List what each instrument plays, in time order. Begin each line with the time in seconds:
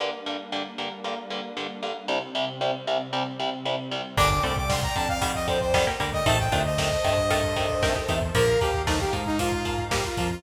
0.00 overdriven guitar G2 D3 A#3, pad 5 (bowed) G3 A#3 D4
0.26 overdriven guitar G2 D3 A#3
0.52 overdriven guitar G2 D3 A#3
0.78 overdriven guitar G2 D3 A#3
1.04 overdriven guitar G2 D3 A#3
1.30 overdriven guitar G2 D3 A#3
1.57 overdriven guitar G2 D3 A#3
1.83 overdriven guitar G2 D3 A#3
2.08 overdriven guitar C2 C3 G3, pad 5 (bowed) C3 G3 C4
2.35 overdriven guitar C2 C3 G3
2.61 overdriven guitar C2 C3 G3
2.87 overdriven guitar C2 C3 G3
3.13 overdriven guitar C2 C3 G3
3.39 overdriven guitar C2 C3 G3
3.65 overdriven guitar C2 C3 G3
3.91 overdriven guitar C2 C3 G3
4.17 synth bass 1 G1, overdriven guitar D3 G3, pizzicato strings A#3 D4, pad 5 (bowed) D5 G5, lead 2 (sawtooth) D6, kick, crash
4.30 lead 2 (sawtooth) D6, kick
4.43 synth bass 1 C2, overdriven guitar D3 G3, pizzicato strings A3 C4, lead 2 (sawtooth) D6, kick, closed hi-hat
4.57 lead 2 (sawtooth) D6, kick
4.69 overdriven guitar D3 G3, lead 2 (sawtooth) C6, kick, snare
4.83 lead 2 (sawtooth) A#5, kick
4.96 synth bass 1 F2, overdriven guitar D3 G3, lead 2 (sawtooth) A5, kick, closed hi-hat
5.09 lead 2 (sawtooth) F5, kick
5.22 overdriven guitar D3 G3, pizzicato strings D#3 G3, kick, closed hi-hat
5.35 lead 2 (sawtooth) D#5, kick
5.48 overdriven guitar D3 G3, lead 2 (sawtooth) C5, kick, closed hi-hat
5.61 lead 2 (sawtooth) C5, kick
5.74 overdriven guitar D3 G3, pizzicato strings D#3 G3, kick, snare
5.87 pizzicato strings G3 A#3, kick
6.00 synth bass 1 D2, overdriven guitar D3 G3, pizzicato strings G3 A#3, kick, closed hi-hat
6.13 lead 2 (sawtooth) D#5, kick
6.26 synth bass 1 A1, overdriven guitar C3 D#3 A3, pizzicato strings C4 D#4, pad 5 (bowed) C5 D#5 A5, lead 2 (sawtooth) A5, kick, closed hi-hat
6.39 lead 2 (sawtooth) G5, kick
6.52 synth bass 1 D2, overdriven guitar C3 D#3 A3, pizzicato strings D4 F4, kick, closed hi-hat
6.65 lead 2 (sawtooth) D#5, kick
6.78 overdriven guitar C3 D#3 A3, kick, snare
6.92 kick
7.04 synth bass 1 G2, overdriven guitar C3 D#3 A3, kick, closed hi-hat
7.17 kick
7.30 overdriven guitar C3 D#3 A3, pizzicato strings F4 A4, pad 5 (bowed) A4 C5 A5, kick, closed hi-hat
7.43 kick
7.56 overdriven guitar C3 D#3 A3, kick, closed hi-hat
7.69 kick
7.82 overdriven guitar C3 D#3 A3, pizzicato strings G4 A#4, kick, snare
7.96 pizzicato strings D#4 G4, kick
8.08 synth bass 1 E2, overdriven guitar C3 D#3 A3, pizzicato strings D#4 G4, kick, closed hi-hat
8.22 kick
8.35 synth bass 1 A#1, pizzicato strings D3 F3, overdriven guitar F3 A#3, lead 2 (sawtooth) A#4, pad 5 (bowed) F5 A#5, kick, closed hi-hat
8.48 kick
8.61 synth bass 1 D#2, overdriven guitar F3 A#3, lead 2 (sawtooth) G4, kick, closed hi-hat
8.74 kick
8.87 pizzicato strings F3 A3, overdriven guitar F3 A#3, lead 2 (sawtooth) D#4, kick, snare
9.00 lead 2 (sawtooth) G4, kick
9.13 synth bass 1 G#2, overdriven guitar F3 A#3, kick, closed hi-hat
9.26 lead 2 (sawtooth) D#4, kick
9.39 overdriven guitar F3 A#3, lead 2 (sawtooth) F4, kick, closed hi-hat
9.52 kick
9.65 overdriven guitar F3 A#3, kick, closed hi-hat
9.78 kick
9.91 overdriven guitar F3 A#3, pizzicato strings G3 A#3, lead 2 (sawtooth) G4, kick, snare
10.04 lead 2 (sawtooth) F4, kick
10.17 synth bass 1 F2, overdriven guitar F3 A#3, lead 2 (sawtooth) F4, kick, closed hi-hat
10.30 lead 2 (sawtooth) F4, kick